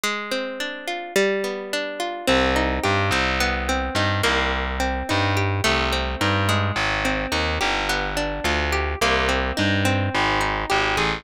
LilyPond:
<<
  \new Staff \with { instrumentName = "Electric Bass (finger)" } { \clef bass \time 4/4 \key c \minor \tempo 4 = 107 r1 | c,4 g,8 c,4. g,8 c,8~ | c,4 g,4 c,4 g,4 | aes,,4 ees,8 g,,4. d,4 |
c,4 g,4 aes,,4 aes,,8 a,,8 | }
  \new Staff \with { instrumentName = "Acoustic Guitar (steel)" } { \time 4/4 \key c \minor aes8 c'8 d'8 f'8 g8 b8 d'8 f'8 | c'8 ees'8 g'8 c'8 b8 c'8 ees'8 bes8~ | bes8 c'8 ees'8 g'8 a8 c'8 ees'8 aes8~ | aes8 c'8 ees'8 g'8 b8 d'8 f'8 g'8 |
bes8 c'8 ees'8 c'4 ees'8 g'8 aes'8 | }
>>